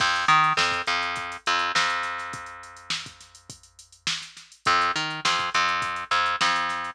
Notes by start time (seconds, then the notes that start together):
0.00 F2, kick, crash
0.16 closed hi-hat
0.28 D#3, closed hi-hat
0.44 closed hi-hat
0.57 F2, snare
0.71 kick, snare, closed hi-hat
0.87 F2, closed hi-hat
1.01 snare, closed hi-hat
1.16 kick, closed hi-hat
1.32 closed hi-hat
1.46 F2, closed hi-hat
1.59 closed hi-hat
1.75 F2, snare
1.90 closed hi-hat
2.03 snare, closed hi-hat
2.18 snare, closed hi-hat
2.33 kick, closed hi-hat
2.46 closed hi-hat
2.63 closed hi-hat
2.77 closed hi-hat
2.90 snare
3.06 kick, closed hi-hat
3.21 snare, closed hi-hat
3.35 closed hi-hat
3.50 kick, closed hi-hat
3.63 closed hi-hat
3.79 closed hi-hat
3.92 closed hi-hat
4.07 snare
4.22 snare, closed hi-hat
4.37 snare, closed hi-hat
4.52 closed hi-hat
4.65 F2, kick, closed hi-hat
4.81 snare, closed hi-hat
4.96 D#3, closed hi-hat
5.10 closed hi-hat
5.25 F2, snare
5.38 kick, snare, closed hi-hat
5.54 F2, closed hi-hat
5.68 closed hi-hat
5.82 kick, closed hi-hat
5.96 closed hi-hat
6.11 F2, snare, closed hi-hat
6.26 closed hi-hat
6.41 F2, snare
6.56 closed hi-hat
6.69 snare, closed hi-hat
6.84 closed hi-hat